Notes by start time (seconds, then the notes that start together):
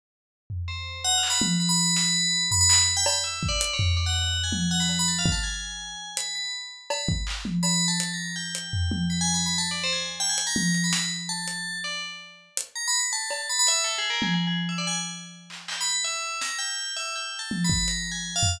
0.50 floor tom
0.68 C5
1.04 F#5
1.18 F5
1.23 clap
1.30 B5
1.41 high tom
1.60 B5
1.69 B5
1.96 snare
2.51 B5, floor tom
2.61 B5
2.70 B5, clap
2.97 G5
3.06 B5, cowbell
3.24 E5
3.43 kick
3.49 D5
3.61 closed hi-hat
3.73 C#5
3.79 floor tom
3.97 D5
4.06 F#5
4.44 G#5
4.52 high tom
4.71 F#5
4.80 B5
4.89 cowbell
4.99 B5
5.08 A5
5.19 F5
5.26 kick
5.32 A5
5.43 G#5
6.17 B5, closed hi-hat
6.35 B5
6.90 B5, cowbell
7.09 kick
7.27 clap
7.45 high tom
7.63 B5, cowbell
7.88 A5
8.00 closed hi-hat
8.13 A#5
8.36 G5
8.55 closed hi-hat
8.73 floor tom
8.91 high tom
9.10 B5
9.21 G#5
9.34 B5
9.46 B5
9.58 A5
9.71 D5
9.84 C5
9.93 G#5
10.20 G5
10.29 G#5
10.38 closed hi-hat
10.47 A#5
10.56 high tom
10.74 closed hi-hat
10.84 B5
10.93 snare
11.29 A5
11.48 closed hi-hat
11.84 D5
12.57 closed hi-hat
12.76 A#5
12.88 B5
13.00 B5
13.13 A5
13.30 cowbell
13.49 B5
13.59 B5
13.67 E5, closed hi-hat
13.84 A4
13.98 G#4
14.10 A#4
14.22 G#4, high tom
14.34 G#4
14.47 G#4
14.69 E5
14.78 D5
14.87 G#5
15.50 clap
15.68 G5, clap
15.81 B5
15.92 B5
16.04 E5
16.41 A#5, snare
16.59 G5
16.97 E5
17.16 G5
17.39 A5
17.51 high tom
17.64 B5
17.70 kick
17.88 A#5, closed hi-hat
18.12 G#5
18.36 F5
18.43 floor tom